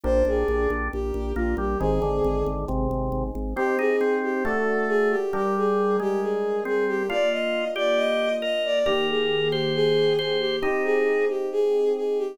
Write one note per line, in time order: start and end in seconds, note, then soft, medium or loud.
0.03 0.23 A#1 loud
0.03 0.88 D4 medium
0.03 1.77 D4 medium
0.03 1.77 G4 medium
0.03 1.77 A#4 medium
0.03 0.23 C5 loud
0.25 0.44 A#1 medium
0.25 0.68 G#4 medium
0.48 0.67 A#1 medium
0.70 0.89 A#1 medium
0.92 1.12 A#1 medium
0.92 1.32 G4 medium
1.14 1.33 A#1 medium
1.36 1.55 A#1 medium
1.36 1.56 A#3 medium
1.36 1.54 F4 medium
1.57 1.76 A#1 medium
1.57 1.78 G3 medium
1.57 1.79 G4 medium
1.80 1.99 G#1 medium
1.80 2.00 D#3 medium
1.80 3.53 C4 medium
1.80 3.53 D#4 medium
1.80 2.43 G#4 medium
1.80 3.53 G#4 medium
2.02 2.20 G#1 medium
2.02 2.65 D3 medium
2.24 2.43 G#1 medium
2.46 2.65 G#1 medium
2.68 2.88 G#1 medium
2.68 3.24 C3 medium
2.91 3.10 G#1 medium
3.12 3.31 G#1 medium
3.35 3.54 G#1 medium
3.56 4.43 C4 medium
3.56 3.78 C4 medium
3.56 4.43 D#4 medium
3.56 4.43 G4 medium
3.56 3.75 G4 loud
3.79 3.96 D#4 medium
3.79 4.15 G#4 loud
4.01 4.44 C4 medium
4.23 4.43 G4 medium
4.44 5.16 A3 medium
4.44 5.31 D4 medium
4.44 5.31 F#4 medium
4.44 4.87 A4 medium
4.44 5.31 A4 medium
4.88 5.08 G#4 loud
5.10 5.31 G4 loud
5.33 7.06 G3 medium
5.33 5.97 G3 medium
5.33 7.06 D4 medium
5.33 5.55 G4 loud
5.33 7.06 A#4 medium
5.57 5.96 G#4 medium
6.00 6.64 G#3 medium
6.00 6.20 G4 loud
6.22 6.60 G#4 medium
6.65 7.03 C4 medium
6.65 6.84 G#4 loud
6.88 7.07 G4 loud
7.09 8.82 A#3 medium
7.09 8.82 D4 medium
7.09 8.82 F4 medium
7.09 7.65 F4 medium
7.09 7.29 D5 loud
7.31 7.68 D#5 loud
7.76 8.29 G4 medium
7.76 7.98 D5 loud
7.96 8.36 D#5 loud
8.42 8.79 A#4 medium
8.42 8.62 D#5 loud
8.65 8.86 D5 loud
8.86 10.59 D#3 medium
8.86 10.59 A#3 medium
8.86 9.06 G4 loud
8.86 10.59 G4 medium
8.86 9.49 A#4 medium
9.09 9.51 G#4 medium
9.51 9.72 G4 loud
9.51 10.13 C5 medium
9.74 10.16 G#4 loud
10.19 10.37 G#4 medium
10.19 10.56 C5 medium
10.40 10.59 G4 loud
10.62 12.35 C4 medium
10.62 12.35 D#4 medium
10.62 11.25 D#4 medium
10.62 10.83 G4 loud
10.62 12.35 G4 medium
10.84 11.25 G#4 loud
11.29 11.48 G4 loud
11.52 11.90 G#4 loud
11.96 12.18 G#4 medium
12.18 12.38 G4 loud